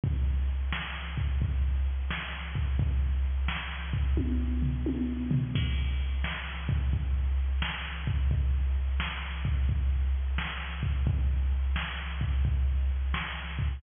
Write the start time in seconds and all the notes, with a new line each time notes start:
0.04 kick, closed hi-hat
0.48 closed hi-hat
0.72 snare
1.17 kick, closed hi-hat
1.42 kick, closed hi-hat
1.86 closed hi-hat
2.10 snare
2.55 kick, closed hi-hat
2.79 kick, closed hi-hat
3.24 closed hi-hat
3.48 snare
3.93 kick, closed hi-hat
4.17 kick, high tom
4.62 floor tom
4.86 high tom
5.31 floor tom
5.55 kick, crash
6.00 closed hi-hat
6.24 snare
6.69 kick, closed hi-hat
6.93 kick, closed hi-hat
7.38 closed hi-hat
7.62 snare
8.07 kick, closed hi-hat
8.31 kick, closed hi-hat
8.76 closed hi-hat
9.00 snare
9.45 kick, closed hi-hat
9.69 kick, closed hi-hat
10.14 closed hi-hat
10.38 snare
10.83 kick, closed hi-hat
11.07 kick, closed hi-hat
11.52 closed hi-hat
11.76 snare
12.21 kick, closed hi-hat
12.45 kick, closed hi-hat
12.90 closed hi-hat
13.14 snare
13.59 kick, closed hi-hat